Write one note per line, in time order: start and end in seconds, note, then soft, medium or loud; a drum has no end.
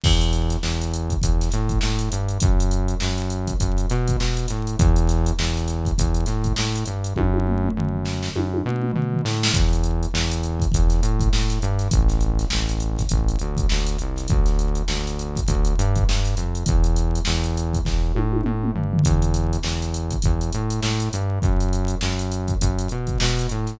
0.04 0.57 E2 loud
0.04 kick loud
0.04 crash loud
0.21 closed hi-hat medium
0.33 snare soft
0.33 closed hi-hat medium
0.50 snare soft
0.50 closed hi-hat medium
0.63 1.15 E2 medium
0.63 snare loud
0.81 closed hi-hat medium
0.94 closed hi-hat medium
1.10 kick medium
1.10 closed hi-hat medium
1.22 1.49 E2 medium
1.22 kick medium
1.22 closed hi-hat loud
1.41 snare soft
1.41 closed hi-hat medium
1.51 1.79 A2 medium
1.51 snare soft
1.51 closed hi-hat medium
1.69 kick medium
1.69 closed hi-hat medium
1.81 2.09 A2 medium
1.81 snare loud
1.99 closed hi-hat medium
2.12 2.38 G2 medium
2.12 closed hi-hat medium
2.28 closed hi-hat medium
2.40 2.95 F#2 loud
2.40 kick loud
2.40 closed hi-hat loud
2.60 closed hi-hat medium
2.71 closed hi-hat medium
2.88 closed hi-hat medium
3.00 3.53 F#2 medium
3.00 snare loud
3.18 snare soft
3.18 closed hi-hat medium
3.30 closed hi-hat medium
3.47 kick medium
3.47 closed hi-hat medium
3.60 3.86 F#2 medium
3.60 kick medium
3.60 closed hi-hat loud
3.78 closed hi-hat medium
3.89 4.16 B2 loud
3.89 snare soft
3.89 closed hi-hat medium
4.08 kick medium
4.08 closed hi-hat medium
4.20 4.47 B2 medium
4.20 snare loud
4.37 closed hi-hat medium
4.48 4.76 A2 medium
4.48 snare soft
4.48 closed hi-hat medium
4.67 closed hi-hat medium
4.79 5.32 E2 loud
4.79 kick loud
4.79 closed hi-hat loud
4.96 closed hi-hat medium
5.08 snare soft
5.08 closed hi-hat medium
5.26 closed hi-hat medium
5.39 5.91 E2 loud
5.39 snare loud
5.57 closed hi-hat medium
5.68 snare soft
5.68 closed hi-hat medium
5.85 kick medium
5.85 closed hi-hat medium
5.98 6.25 E2 loud
5.98 kick medium
5.98 closed hi-hat loud
6.14 closed hi-hat medium
6.26 6.53 A2 medium
6.26 snare soft
6.26 closed hi-hat medium
6.44 kick medium
6.44 closed hi-hat medium
6.56 6.84 A2 medium
6.56 snare loud
6.75 closed hi-hat medium
6.86 7.13 G2 medium
6.86 closed hi-hat medium
7.04 closed hi-hat medium
7.16 7.69 F#2 loud
7.16 kick medium
7.16 high tom medium
7.34 high tom medium
7.47 mid tom medium
7.64 mid tom medium
7.77 8.29 F#2 medium
7.77 floor tom medium
7.94 floor tom medium
8.05 snare medium
8.23 snare medium
8.36 8.62 F#2 medium
8.36 high tom medium
8.54 high tom medium
8.65 8.92 B2 loud
8.65 mid tom medium
8.82 mid tom medium
8.93 9.22 B2 medium
8.93 floor tom medium
9.13 floor tom medium
9.25 9.51 A2 loud
9.25 snare medium
9.43 snare loud
9.54 10.06 E2 loud
9.54 kick loud
9.54 closed hi-hat medium
9.73 closed hi-hat medium
9.84 closed hi-hat medium
10.03 closed hi-hat medium
10.14 10.66 E2 loud
10.14 snare loud
10.31 closed hi-hat medium
10.43 closed hi-hat medium
10.60 kick medium
10.60 closed hi-hat medium
10.72 11.00 E2 medium
10.72 kick loud
10.72 closed hi-hat loud
10.90 snare soft
10.90 closed hi-hat medium
11.03 11.29 A2 medium
11.03 closed hi-hat medium
11.19 kick medium
11.19 closed hi-hat medium
11.33 11.59 A2 medium
11.33 snare loud
11.50 snare soft
11.50 closed hi-hat medium
11.62 11.88 G2 loud
11.62 closed hi-hat medium
11.79 snare soft
11.79 closed hi-hat medium
11.91 12.45 A1 loud
11.91 kick loud
11.91 closed hi-hat loud
12.09 snare soft
12.09 closed hi-hat medium
12.21 closed hi-hat medium
12.39 snare soft
12.39 closed hi-hat medium
12.50 13.04 A1 medium
12.50 snare loud
12.69 closed hi-hat medium
12.80 closed hi-hat medium
12.98 kick medium
12.98 snare soft
12.98 closed hi-hat medium
13.09 13.37 A1 loud
13.09 kick medium
13.09 closed hi-hat loud
13.28 closed hi-hat medium
13.39 13.66 D2 medium
13.39 closed hi-hat medium
13.57 kick medium
13.57 closed hi-hat medium
13.69 13.97 D2 medium
13.69 snare loud
13.87 closed hi-hat medium
13.99 14.27 C2 medium
13.99 closed hi-hat medium
14.16 snare soft
14.16 closed hi-hat medium
14.28 14.82 D2 loud
14.28 kick loud
14.28 closed hi-hat medium
14.46 snare soft
14.46 closed hi-hat medium
14.59 closed hi-hat medium
14.75 closed hi-hat medium
14.88 15.41 D2 medium
14.88 snare loud
15.06 snare soft
15.06 closed hi-hat medium
15.19 closed hi-hat medium
15.36 kick medium
15.36 closed hi-hat medium
15.48 15.74 D2 loud
15.48 kick medium
15.48 closed hi-hat loud
15.65 closed hi-hat medium
15.78 16.04 G2 loud
15.78 closed hi-hat medium
15.95 kick medium
15.95 closed hi-hat medium
16.09 16.35 G2 medium
16.09 snare loud
16.25 snare soft
16.25 closed hi-hat medium
16.37 16.64 F2 medium
16.37 closed hi-hat medium
16.55 closed hi-hat medium
16.66 17.20 E2 loud
16.66 kick loud
16.66 closed hi-hat loud
16.84 closed hi-hat medium
16.96 closed hi-hat medium
17.15 closed hi-hat medium
17.25 17.79 E2 loud
17.25 snare loud
17.44 closed hi-hat medium
17.57 closed hi-hat medium
17.73 kick medium
17.73 closed hi-hat medium
17.85 18.12 E2 medium
17.85 kick medium
17.85 snare medium
18.15 18.42 A2 medium
18.15 high tom medium
18.32 high tom medium
18.44 18.71 A2 medium
18.44 mid tom loud
18.64 mid tom loud
18.75 19.01 G2 medium
18.75 floor tom medium
18.93 floor tom loud
19.04 19.57 E2 loud
19.04 kick medium
19.04 closed hi-hat loud
19.22 closed hi-hat medium
19.34 closed hi-hat medium
19.53 closed hi-hat medium
19.63 20.16 E2 medium
19.63 snare loud
19.82 snare soft
19.82 closed hi-hat medium
19.94 closed hi-hat medium
20.11 kick medium
20.11 closed hi-hat medium
20.22 20.51 E2 medium
20.22 kick medium
20.22 closed hi-hat loud
20.41 closed hi-hat medium
20.52 20.80 A2 medium
20.52 closed hi-hat medium
20.70 closed hi-hat medium
20.82 21.09 A2 loud
20.82 snare loud
21.00 closed hi-hat medium
21.13 21.39 G2 loud
21.13 closed hi-hat medium
21.42 21.95 F#2 loud
21.42 kick loud
21.42 closed hi-hat medium
21.60 closed hi-hat medium
21.73 closed hi-hat medium
21.88 closed hi-hat medium
22.01 22.54 F#2 medium
22.01 snare loud
22.19 closed hi-hat medium
22.32 closed hi-hat medium
22.48 kick medium
22.48 closed hi-hat medium
22.61 22.88 F#2 loud
22.61 kick medium
22.61 closed hi-hat loud
22.79 closed hi-hat medium
22.89 23.18 B2 medium
22.89 closed hi-hat medium
23.07 kick medium
23.07 closed hi-hat medium
23.20 23.47 B2 loud
23.20 snare loud
23.38 snare soft
23.38 closed hi-hat medium
23.49 23.77 A2 medium
23.49 closed hi-hat medium
23.67 snare soft
23.67 closed hi-hat medium